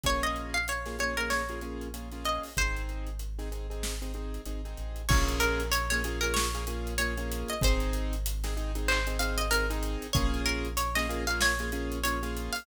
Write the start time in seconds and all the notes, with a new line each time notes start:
0.04 A#1 A#3 C#4 F4 G#4 C#5, kick, closed hi-hat
0.23 D#5, closed hi-hat
0.36 closed hi-hat
0.54 F5, closed hi-hat
0.68 C#5, closed hi-hat
0.86 A#3 C#4 F4 G#4, snare, closed hi-hat
0.99 A#3 C#4 F4 G#4 C#5, closed hi-hat
1.17 A#3 C#4 F4 G#4 A#4, closed hi-hat
1.30 C#5, snare
1.49 A#3 C#4 F4 G#4, closed hi-hat
1.61 A#3 C#4 F4 G#4, closed hi-hat
1.81 closed hi-hat
1.94 A#3 C#4 F4 G#4, closed hi-hat
2.12 A#3 C#4 F4 G#4, snare, closed hi-hat
2.25 D#5, closed hi-hat
2.43 open hi-hat
2.57 G#1 C4 D#4 G#4 C5, kick, closed hi-hat
2.77 closed hi-hat
2.89 closed hi-hat
3.07 closed hi-hat
3.19 closed hi-hat
3.39 C4 D#4 G#4, snare, closed hi-hat
3.52 C4 D#4 G#4, closed hi-hat
3.70 C4 D#4 G#4, closed hi-hat
3.83 snare
4.02 C4 D#4 G#4, closed hi-hat
4.14 C4 D#4 G#4, closed hi-hat
4.34 closed hi-hat
4.46 G#1 C4 D#4 G#4, closed hi-hat
4.65 C4 D#4 G#4, closed hi-hat
4.77 A1, closed hi-hat
4.96 closed hi-hat
5.09 A#1 A#3 C#4 F4 G#4 C#5, kick, crash
5.28 closed hi-hat
5.40 A#4, closed hi-hat
5.60 closed hi-hat
5.72 C#5, closed hi-hat
5.90 A#3 C#4 F4 G#4 C#5, snare, closed hi-hat
6.04 A#3 C#4 F4 G#4, closed hi-hat
6.21 A#3 C#4 F4 G#4 A#4, closed hi-hat
6.34 C#5, snare
6.54 A#3 C#4 F4 G#4, closed hi-hat
6.67 A#3 C#4 F4 G#4, closed hi-hat
6.87 closed hi-hat
6.98 A#3 C#4 F4 G#4 C#5, closed hi-hat
7.18 A#3 C#4 F4 G#4, closed hi-hat
7.32 closed hi-hat
7.48 D#5, closed hi-hat
7.61 G#1 C4 D#4 G#4 C5, kick, closed hi-hat
7.80 closed hi-hat
7.93 closed hi-hat
8.13 closed hi-hat
8.26 closed hi-hat
8.44 C4 D#4 G#4, snare, closed hi-hat
8.57 C4 D#4 G#4, closed hi-hat
8.75 C4 D#4 G#4, closed hi-hat
8.88 C5, clap
9.07 C4 D#4 G#4, closed hi-hat
9.19 C4 D#4 G#4 F5, closed hi-hat
9.38 D#5, closed hi-hat
9.51 C4 D#4 G#4 A#4, closed hi-hat
9.70 C4 D#4 G#4, closed hi-hat
9.83 closed hi-hat
10.02 closed hi-hat
10.13 A#1 A#3 C#4 F4 G#4 C#5, kick, closed hi-hat
10.34 closed hi-hat
10.46 A#4, closed hi-hat
10.65 closed hi-hat
10.77 C#5, closed hi-hat
10.95 A#3 C#4 F4 G#4 D#5, snare, closed hi-hat
11.09 A#3 C#4 F4 G#4, closed hi-hat
11.27 A#3 C#4 F4 G#4 F5, closed hi-hat
11.41 C#5, snare
11.59 A#3 C#4 F4 G#4, closed hi-hat
11.72 A#3 C#4 F4 G#4, closed hi-hat
11.92 closed hi-hat
12.04 A#3 C#4 F4 G#4 C#5, closed hi-hat
12.23 A#3 C#4 F4 G#4, snare, closed hi-hat
12.37 closed hi-hat
12.53 F5, open hi-hat